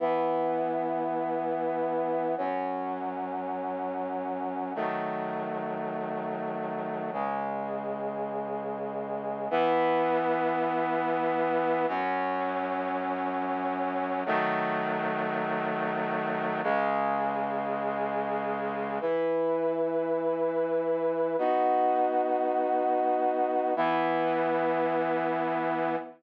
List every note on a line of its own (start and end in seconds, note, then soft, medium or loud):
0.00 2.35 E3 medium
0.00 2.35 B3 medium
0.00 2.35 E4 medium
2.38 4.73 F#2 medium
2.38 4.73 F#3 medium
2.38 4.73 C#4 medium
4.75 7.11 D#3 medium
4.75 7.11 F#3 medium
4.75 7.11 A3 medium
7.13 9.48 C#2 medium
7.13 9.48 C#3 medium
7.13 9.48 G#3 medium
9.51 11.86 E3 loud
9.51 11.86 B3 loud
9.51 11.86 E4 medium
11.88 14.23 F#2 loud
11.88 14.23 F#3 loud
11.88 14.23 C#4 loud
14.26 16.61 D#3 loud
14.26 16.61 F#3 loud
14.26 16.61 A3 loud
16.63 18.99 C#2 medium
16.63 18.99 C#3 loud
16.63 18.99 G#3 medium
19.01 21.36 E3 medium
19.01 21.36 E4 medium
19.01 21.36 B4 medium
21.38 23.74 B3 medium
21.38 23.74 D#4 medium
21.38 23.74 F#4 medium
23.76 25.96 E3 loud
23.76 25.96 B3 loud
23.76 25.96 E4 medium